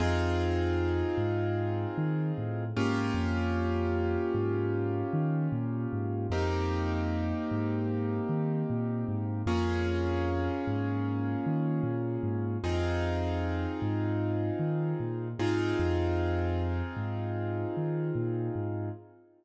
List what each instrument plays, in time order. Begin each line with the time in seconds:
0.00 synth bass 2 F2, acoustic grand piano C4 D#4 F4 G#4
1.17 synth bass 2 G#2
1.98 synth bass 2 D#3
2.38 synth bass 2 A2
2.76 synth bass 2 G#2, acoustic grand piano A#3 C#4 F4 G4
3.14 synth bass 2 F2
4.34 synth bass 2 G#2
5.13 synth bass 2 D#3
5.52 synth bass 2 A#2
5.93 synth bass 2 G#2
6.30 synth bass 2 F2, acoustic grand piano A#3 C4 D#4 G4
7.51 synth bass 2 G#2
8.29 synth bass 2 D#3
8.70 synth bass 2 A#2
9.08 synth bass 2 G#2
9.46 synth bass 2 F2, acoustic grand piano A#3 C#4 F4 G#4
10.67 synth bass 2 G#2
11.46 synth bass 2 D#3
11.83 synth bass 2 A#2
12.23 synth bass 2 G#2
12.63 synth bass 2 F2, acoustic grand piano C4 D#4 F4 G#4
13.82 synth bass 2 G#2
14.59 synth bass 2 D#3
15.00 synth bass 2 A#2
15.39 synth bass 2 G#2, acoustic grand piano C4 D#4 F4 G#4
15.79 synth bass 2 F2
16.97 synth bass 2 G#2
17.77 synth bass 2 D#3
18.15 synth bass 2 A#2
18.56 synth bass 2 G#2